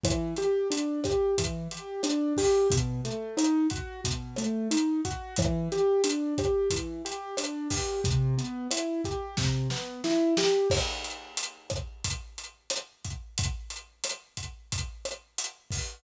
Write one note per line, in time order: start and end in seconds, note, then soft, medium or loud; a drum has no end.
0.03 0.34 E3 medium
0.03 kick loud
0.03 cross-stick loud
0.03 closed hi-hat loud
0.36 0.68 G4 medium
0.36 closed hi-hat medium
0.70 1.00 D4 medium
0.70 closed hi-hat loud
1.04 1.35 G4 medium
1.04 kick medium
1.04 cross-stick medium
1.04 closed hi-hat medium
1.38 1.68 E3 medium
1.38 kick medium
1.38 closed hi-hat loud
1.71 2.01 G4 medium
1.71 closed hi-hat medium
2.03 2.33 D4 medium
2.03 cross-stick medium
2.03 closed hi-hat loud
2.37 2.68 G4 medium
2.37 kick medium
2.37 open hi-hat medium
2.70 3.01 B2 medium
2.70 kick loud
2.70 closed hi-hat loud
3.05 3.35 A3 medium
3.05 closed hi-hat medium
3.37 3.67 D#4 medium
3.37 cross-stick medium
3.37 closed hi-hat loud
3.70 4.01 F#4 medium
3.70 kick medium
3.70 closed hi-hat medium
4.04 4.36 B2 medium
4.04 kick medium
4.04 closed hi-hat loud
4.36 4.68 A3 medium
4.36 cross-stick medium
4.36 closed hi-hat medium
4.71 5.01 D#4 medium
4.71 closed hi-hat loud
5.05 5.35 F#4 medium
5.05 kick medium
5.05 closed hi-hat medium
5.36 5.68 E3 medium
5.36 kick loud
5.36 cross-stick loud
5.36 closed hi-hat loud
5.72 6.02 G4 medium
5.72 closed hi-hat medium
6.04 6.34 D4 medium
6.04 closed hi-hat loud
6.38 6.68 G4 medium
6.38 kick medium
6.38 cross-stick medium
6.38 closed hi-hat medium
6.70 7.02 E3 medium
6.70 kick medium
6.70 closed hi-hat loud
7.05 7.35 G4 medium
7.05 closed hi-hat medium
7.37 7.68 D4 medium
7.37 cross-stick loud
7.37 closed hi-hat loud
7.70 8.00 G4 medium
7.70 kick medium
7.70 open hi-hat medium
8.04 8.35 C3 medium
8.04 kick loud
8.04 closed hi-hat loud
8.38 8.68 B3 medium
8.38 closed hi-hat medium
8.71 9.01 E4 medium
8.71 cross-stick medium
8.71 closed hi-hat loud
9.04 9.35 G4 medium
9.04 kick medium
9.04 closed hi-hat medium
9.37 9.68 C3 medium
9.37 kick medium
9.37 snare medium
9.70 10.01 B3 medium
9.70 snare medium
10.04 10.34 E4 medium
10.04 snare medium
10.37 10.68 G4 medium
10.37 snare loud
10.70 kick loud
10.70 cross-stick loud
10.70 crash loud
11.04 closed hi-hat medium
11.37 closed hi-hat loud
11.70 kick medium
11.70 cross-stick loud
11.70 closed hi-hat medium
12.04 kick medium
12.04 closed hi-hat loud
12.38 closed hi-hat medium
12.70 cross-stick medium
12.70 closed hi-hat loud
13.04 kick medium
13.04 closed hi-hat medium
13.38 kick loud
13.38 closed hi-hat loud
13.70 closed hi-hat medium
14.04 cross-stick medium
14.04 closed hi-hat loud
14.37 kick medium
14.37 closed hi-hat medium
14.72 kick medium
14.72 closed hi-hat loud
15.05 cross-stick medium
15.05 closed hi-hat medium
15.38 closed hi-hat loud
15.70 kick medium
15.70 open hi-hat medium